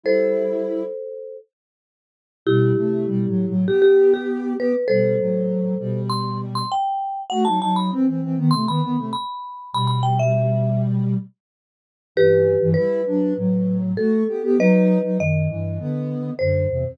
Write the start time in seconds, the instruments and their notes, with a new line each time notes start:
0.04 ocarina G3 E4, marimba A4 C5
2.46 ocarina B2 G3, marimba E4 G4
2.76 ocarina C3 A3
3.07 ocarina B2 G3
3.27 ocarina A2 F#3
3.47 ocarina A2 F#3
3.67 ocarina B3 G4, marimba G4
3.82 marimba G4
4.14 marimba G4
4.58 ocarina B3 G4, marimba B4
4.88 ocarina B2 G3, marimba A4 C5
5.19 ocarina A2 F#3
5.79 ocarina B2 G3
6.10 marimba C6
6.55 marimba C6
6.72 marimba G5
7.30 ocarina A3 F#4, marimba F#5
7.45 ocarina F#3 D#4, marimba A5
7.61 ocarina F#3 D#4, marimba A5
7.76 marimba B5
7.91 ocarina E3 C4
8.07 ocarina E3 C4
8.22 ocarina E3 C4
8.37 ocarina D#3 B3
8.51 ocarina C3 A3, marimba C6
8.67 ocarina D#3 B3, marimba B5
8.82 ocarina D#3 B3
8.97 ocarina C3 A3
9.13 marimba B5
9.73 ocarina B2 G3, marimba B5
9.88 marimba B5
10.03 marimba G5
10.19 marimba E5
12.16 ocarina G2 E3, marimba G4 B4
12.61 ocarina G2 E3
12.74 ocarina G3 E4, marimba B4
13.07 ocarina F#3 D4
13.37 ocarina A2 F#3
13.97 ocarina A3 F#4, marimba A4
14.28 ocarina B3 G4
14.43 ocarina B3 G4
14.58 ocarina F#3 D#4, marimba B4 D#5
15.04 ocarina F#3 D#4
15.19 ocarina F#2 D#3, marimba D#5
15.49 ocarina G2 E3
15.79 ocarina D3 B3
16.39 ocarina F#2 D3, marimba C5
16.70 ocarina E2 C3
16.85 ocarina E2 C3